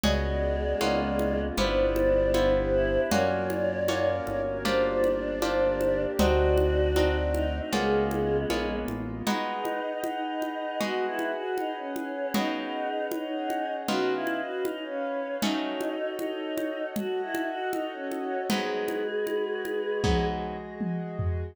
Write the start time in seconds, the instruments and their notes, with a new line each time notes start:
0.03 synth bass 1 C#2, choir aahs G#3, acoustic guitar (steel) B3 C#4 F#4 G#4, pad 2 (warm) B3 C#4 F#4 G#4, flute D5, low conga
0.80 synth bass 1 C#2, pad 2 (warm) A#3 B3 C#4 F4, acoustic guitar (steel) A#3 B3 C#4 F4, high conga
1.19 high conga
1.57 synth bass 1 G1, pad 2 (warm) B3 E4 F4 G4, acoustic guitar (steel) B3 E4 F4 G4, choir aahs D4, flute C5, low conga
1.96 high conga
2.34 acoustic guitar (steel) B3 E4 F4 G4, pad 2 (warm) B3 D4 E4 G4, high conga
2.73 choir aahs E4
3.10 synth bass 1 F#2, pad 2 (warm) A#3 C#4 F4 F#4, acoustic guitar (steel) A#3 C#4 F4 F#4, choir aahs C#5, flute D5, low conga
3.50 high conga
3.88 acoustic guitar (steel) A#3 C#4 F4 F#4, pad 2 (warm) A#3 C#4 F#4 A#4, high conga
4.27 synth bass 1 G1, choir aahs C#5, high conga
4.65 acoustic guitar (steel) A#3 D4 F4 G4, pad 2 (warm) A#3 D4 F4 G4, choir aahs D4, flute C5, low conga
5.04 high conga
5.42 pad 2 (warm) A#3 D4 G4 A#4, acoustic guitar (steel) A#3 D4 F4 G4, high conga
5.81 high conga
6.17 synth bass 1 D2, pad 2 (warm) C4 D4 D#4 F#4, acoustic guitar (steel) C4 D4 D#4 F#4, choir aahs F#4, flute D5, low conga
6.57 high conga
6.96 pad 2 (warm) A3 C4 D4 F#4, acoustic guitar (steel) C4 D4 D#4 F#4, high conga
7.34 choir aahs D#4, high conga
7.54 choir aahs D#4
7.72 synth bass 1 C#2, choir aahs G#3, acoustic guitar (steel) A#3 B3 C#4 F4, pad 2 (warm) A#3 B3 C#4 F4, flute G#4, low conga
8.11 high conga
8.50 synth bass 1 A#1, pad 2 (warm) G#3 A#3 B3 F4, acoustic guitar (steel) A#3 B3 C#4 F4, high conga
8.88 synth bass 1 A1, high conga
9.27 acoustic guitar (steel) G#3 B3 D#4 F#4, choir aahs D#4, pad 2 (warm) G#4 B4 D#5 F#5, low conga
9.65 high conga
10.04 choir aahs D#4, high conga
10.42 high conga
10.80 acoustic guitar (steel) G#3 B3 D#4 F#4, choir aahs F#4, pad 2 (warm) G#4 B4 F#5 G#5, low conga
11.06 choir aahs E4
11.19 high conga
11.32 choir aahs F#4
11.58 choir aahs D#4, high conga
11.77 choir aahs C#4
11.96 high conga
12.34 acoustic guitar (steel) C#3 B3 F#4 G#4, pad 2 (warm) C#4 G#4 B4 F#5, choir aahs D#4, low conga
13.12 pad 2 (warm) C#4 G#4 C#5 F#5, choir aahs D#4, high conga
13.50 high conga
13.88 acoustic guitar (steel) C#3 B3 D#4 F4, pad 2 (warm) C#4 B4 D#5 F5, choir aahs F#4, low conga
14.14 choir aahs E4
14.27 high conga
14.40 choir aahs F#4
14.65 pad 2 (warm) C#4 B4 C#5 F5, choir aahs D#4, high conga
14.85 choir aahs C#4
15.42 acoustic guitar (steel) F#3 A3 C#4 D#4, choir aahs D#4, pad 2 (warm) F#4 A4 C#5 D#5, low conga
15.81 high conga
16.19 choir aahs D#4, high conga
16.58 high conga
16.96 choir aahs F#4, pad 2 (warm) F#4 A4 D#5 F#5, low conga
17.22 choir aahs E4
17.35 high conga
17.47 choir aahs F#4
17.73 choir aahs D#4, high conga
17.92 choir aahs C#4
18.11 high conga
18.50 acoustic guitar (steel) G#2 F#3 B3 D#4, pad 2 (warm) G#3 F#4 B4 D#5, choir aahs G#4, low conga
18.88 high conga
19.27 high conga
19.65 high conga
20.04 acoustic guitar (steel) G#2 F#3 B3 D#4, pad 2 (warm) G#3 F#4 G#4 D#5, kick, high tom
20.81 high tom
21.19 floor tom